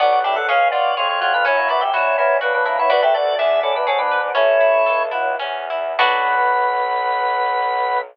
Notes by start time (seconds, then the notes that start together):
0.00 B1 B3 D4 F#4 D5
0.12 F#4
0.24 D4 E4 G4 E5
0.36 A4 F#5
0.48 C#2 C#4 G#4 F5
0.71 F4 F#4 D5
0.97 F2 F4 G#4 C#5
1.09 F4 C#5
1.21 F4 F#4 C#5
1.33 D4 F4 B4
1.45 F#2 C#4 E4 C#5
1.57 A#3
1.68 B3 E4 F#4 D5
1.81 G4 E5
1.93 A#2 E4 F#4 C#5
2.18 B3 E4 A#4 C#5
2.41 C#3 D4 F#4 B4
2.54 D4 B4
2.65 A#3 D4 E4 B4
2.78 B3 E4 C#5
2.89 D2 D4 F#4 B4 D5
3.02 G4 A4 E5
3.14 F#4 A4 D5
3.39 E2 D4 G#4 E5
3.63 C#4 E4 A4
3.75 D4 B4
3.87 G#2 C#4 G#4 A4
3.98 D4 B4
4.11 B4
4.34 A1 A3 C#4 E4 C#5
4.60 E4
4.86 C#2 A4
5.11 F#3 E4
5.39 E2 C#4
5.70 E4
5.98 B1 B3 D4 F#4 B4